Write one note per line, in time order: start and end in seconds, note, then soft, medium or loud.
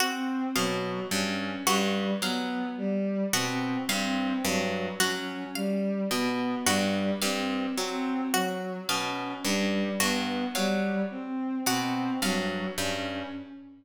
0.00 0.44 C4 medium
0.00 0.45 F#4 medium
0.56 1.00 B2 medium
0.56 1.00 F#3 medium
0.56 1.00 F5 medium
1.11 1.56 G2 medium
1.11 1.56 C#4 medium
1.67 2.11 G2 medium
1.67 2.11 G3 medium
1.67 2.11 F#4 medium
2.22 2.66 F#3 medium
2.22 2.66 B3 medium
2.22 2.67 F5 medium
2.78 3.22 G3 medium
3.33 3.78 B2 medium
3.33 3.77 C4 medium
3.33 3.78 F#4 medium
3.89 4.33 G2 medium
3.89 4.33 C4 medium
3.89 4.34 F5 medium
4.44 4.89 G2 medium
4.44 4.89 F#3 medium
5.00 5.44 F#3 medium
5.00 5.44 C#4 medium
5.00 5.44 F#4 medium
5.55 6.00 G3 medium
5.55 6.00 F5 medium
6.11 6.55 B2 medium
6.11 6.56 B3 medium
6.66 7.11 G2 medium
6.66 7.11 G3 medium
6.66 7.11 F#4 medium
7.22 7.66 G2 medium
7.22 7.67 C4 medium
7.22 7.66 F5 medium
7.78 8.22 F#3 medium
7.78 8.22 C4 medium
8.34 8.78 F#3 medium
8.34 8.78 F#4 medium
8.89 9.34 B2 medium
8.89 9.33 C#4 medium
8.89 9.33 F5 medium
9.44 9.89 G2 medium
9.44 9.89 G3 medium
10.00 10.45 G2 medium
10.00 10.45 B3 medium
10.00 10.44 F#4 medium
10.55 11.00 F#3 medium
10.55 11.00 G3 medium
10.55 10.99 F5 medium
11.11 11.55 C4 medium
11.66 12.11 B2 medium
11.66 12.11 C4 medium
11.66 12.11 F#4 medium
12.22 12.66 G2 medium
12.22 12.67 F#3 medium
12.22 12.67 F5 medium
12.78 13.22 G2 medium
12.78 13.22 C#4 medium